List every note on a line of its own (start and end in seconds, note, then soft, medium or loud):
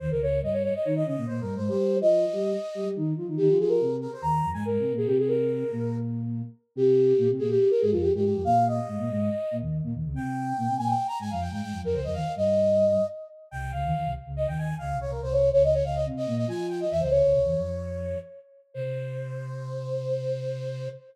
0.00 0.10 D#2 medium
0.00 0.10 D#3 medium
0.00 0.09 C5 loud
0.10 0.20 C#2 medium
0.10 0.20 C#3 medium
0.10 0.21 A#4 loud
0.21 0.41 C#2 medium
0.21 0.41 C#3 medium
0.21 0.39 C#5 loud
0.42 0.69 G2 medium
0.42 0.69 G3 medium
0.42 0.53 D#5 medium
0.53 0.63 C#5 loud
0.63 0.73 C#5 loud
0.75 0.85 D#5 medium
0.84 1.03 D#3 medium
0.84 1.03 D#4 medium
0.84 0.94 C#5 loud
0.96 1.06 D#5 loud
1.06 1.16 C#3 medium
1.06 1.16 C#4 medium
1.06 1.25 D#5 loud
1.17 1.27 A#2 medium
1.17 1.27 A#3 medium
1.27 1.40 A#2 medium
1.27 1.40 A#3 medium
1.27 1.40 C5 loud
1.41 1.55 G2 medium
1.41 1.55 G3 medium
1.41 1.54 A#4 loud
1.56 1.69 G#2 medium
1.56 1.69 G#3 medium
1.56 1.68 C5 medium
1.68 1.97 G3 medium
1.68 1.97 G4 loud
1.68 1.97 C5 loud
2.00 2.26 F3 medium
2.00 2.26 F4 medium
2.00 2.87 D#5 loud
2.33 2.53 G3 medium
2.33 2.53 G4 medium
2.75 2.84 G3 medium
2.75 2.84 G4 medium
2.85 2.95 G3 medium
2.85 2.95 G4 medium
2.96 3.13 D#3 medium
2.96 3.13 D#4 medium
3.17 3.27 F3 medium
3.17 3.27 F4 medium
3.28 3.38 D#3 medium
3.28 3.38 D#4 medium
3.37 3.48 D#3 medium
3.37 3.48 D#4 loud
3.37 3.57 G4 loud
3.49 3.58 F3 medium
3.49 3.58 F4 medium
3.59 3.79 F3 medium
3.59 3.79 F4 medium
3.59 3.69 G#4 loud
3.68 3.95 A#4 medium
3.80 4.07 C3 medium
3.80 4.07 C4 medium
4.01 4.11 A#4 loud
4.13 4.23 C5 loud
4.22 4.42 D#2 medium
4.22 4.42 D#3 medium
4.22 4.49 A#5 loud
4.43 4.53 F2 medium
4.43 4.53 F3 medium
4.53 4.63 G#2 medium
4.53 4.63 G#3 medium
4.53 4.64 G#5 loud
4.65 4.78 G#2 medium
4.65 4.78 G#3 medium
4.65 4.93 A#4 medium
4.79 4.92 C3 medium
4.79 4.92 C4 medium
4.92 5.05 A#2 medium
4.92 5.05 A#3 medium
4.97 5.07 G#4 loud
5.06 5.64 C3 medium
5.06 5.64 C4 medium
5.06 5.16 G4 loud
5.18 5.28 G#4 loud
5.28 5.96 A#4 loud
5.71 6.42 A#2 medium
5.71 6.42 A#3 medium
6.76 7.13 C3 medium
6.76 7.13 C4 loud
6.76 7.28 G4 loud
7.18 7.28 A#2 medium
7.18 7.28 A#3 medium
7.30 7.40 C3 medium
7.30 7.40 C4 medium
7.39 7.57 A#2 medium
7.39 7.57 A#3 medium
7.39 7.49 G#4 loud
7.49 7.69 G4 loud
7.70 7.80 A#4 medium
7.80 7.92 G#2 medium
7.80 7.92 G#3 medium
7.80 7.90 G#4 loud
7.92 8.10 F2 medium
7.92 8.10 F3 medium
7.92 8.02 F4 medium
8.01 8.11 G4 loud
8.14 8.23 G#2 medium
8.14 8.23 G#3 medium
8.14 8.24 G4 loud
8.24 8.34 G#2 medium
8.24 8.34 G#3 medium
8.24 8.42 G4 medium
8.35 8.45 F2 medium
8.35 8.45 F3 medium
8.44 8.80 A#2 medium
8.44 8.80 A#3 medium
8.44 8.65 F5 loud
8.68 9.56 D#5 loud
8.87 8.98 G#2 medium
8.87 8.98 G#3 medium
8.99 9.09 A#2 medium
8.99 9.09 A#3 medium
9.10 9.29 G#2 medium
9.10 9.29 G#3 medium
9.51 9.61 A#2 medium
9.51 9.61 A#3 medium
9.61 9.81 D#2 medium
9.61 9.81 D#3 medium
9.83 9.93 A#2 medium
9.83 9.93 A#3 medium
9.94 10.04 D#2 medium
9.94 10.04 D#3 medium
10.04 10.14 C#2 medium
10.04 10.14 C#3 medium
10.14 10.53 C3 medium
10.14 10.53 C4 medium
10.14 10.76 G5 loud
10.57 10.68 A#2 medium
10.57 10.68 A#3 medium
10.68 10.78 C3 medium
10.68 10.78 C4 medium
10.77 10.94 A#2 medium
10.77 10.94 A#3 medium
10.77 10.88 G#5 loud
10.87 11.06 G5 medium
11.08 11.18 A#5 loud
11.19 11.29 G#2 medium
11.19 11.29 G#3 medium
11.19 11.31 G#5 loud
11.31 11.49 F2 medium
11.31 11.49 F3 medium
11.31 11.41 F5 medium
11.41 11.51 G5 medium
11.51 11.61 G#2 medium
11.51 11.61 G#3 medium
11.51 11.61 G5 medium
11.61 11.72 G#2 medium
11.61 11.72 G#3 medium
11.61 11.79 G5 loud
11.72 11.82 F2 medium
11.72 11.82 F3 medium
11.82 11.92 F2 medium
11.82 11.92 F3 medium
11.82 11.95 A#4 loud
11.93 12.04 C#2 medium
11.93 12.04 C#3 medium
11.93 12.04 C5 medium
12.04 12.15 F2 medium
12.04 12.15 F3 medium
12.04 12.14 D#5 medium
12.14 12.24 D#2 medium
12.14 12.24 D#3 medium
12.14 12.32 F5 loud
12.36 12.98 G2 medium
12.36 12.98 G3 medium
12.36 13.05 D#5 loud
13.51 13.72 C2 medium
13.51 13.72 C3 medium
13.51 13.71 G5 loud
13.72 13.83 C#2 medium
13.72 13.83 C#3 medium
13.72 14.11 F5 loud
13.84 13.94 D#2 medium
13.84 13.94 D#3 medium
13.95 14.05 D#2 medium
13.95 14.05 D#3 medium
14.05 14.15 C2 medium
14.05 14.15 C3 medium
14.26 14.46 C#2 medium
14.26 14.46 C#3 medium
14.36 14.46 D#5 loud
14.47 14.74 D#2 medium
14.47 14.74 D#3 medium
14.47 14.57 G5 loud
14.58 14.75 G#5 loud
14.78 14.93 C#2 medium
14.78 14.93 C#3 medium
14.78 14.97 F5 loud
14.93 15.06 C2 medium
14.93 15.06 C3 medium
15.01 15.11 C#5 loud
15.07 15.20 C2 medium
15.07 15.20 C3 medium
15.07 15.21 A#4 medium
15.20 15.51 C2 medium
15.20 15.51 C3 loud
15.20 15.32 C5 loud
15.32 15.49 C#5 loud
15.52 15.82 C#2 medium
15.52 15.82 C#3 medium
15.52 15.62 C#5 loud
15.63 15.73 D#5 medium
15.74 15.84 C#5 loud
15.84 16.06 C#2 medium
15.84 16.06 C#3 medium
15.84 15.94 F5 medium
15.95 16.05 D#5 loud
16.06 16.27 C3 medium
16.06 16.27 C4 medium
16.17 16.35 D#5 loud
16.27 16.45 A#2 medium
16.27 16.45 A#3 medium
16.37 16.47 D#5 loud
16.47 16.84 F3 medium
16.47 16.84 F4 medium
16.47 16.67 G#5 loud
16.69 16.79 G5 medium
16.80 16.90 D#5 medium
16.90 17.01 E2 medium
16.90 17.01 E3 medium
16.90 17.01 E5 loud
17.00 17.11 C#2 medium
17.00 17.11 C#3 medium
17.00 17.11 C5 medium
17.10 17.22 C#2 medium
17.10 17.22 C#3 medium
17.10 18.18 C#5 medium
17.23 17.33 C#2 medium
17.23 17.33 C#3 medium
17.33 17.44 C2 medium
17.33 17.44 C3 medium
17.44 17.55 E2 medium
17.44 17.55 E3 medium
17.56 18.14 F2 medium
17.56 18.14 F3 medium
18.74 20.88 C3 loud
18.74 20.87 C5 loud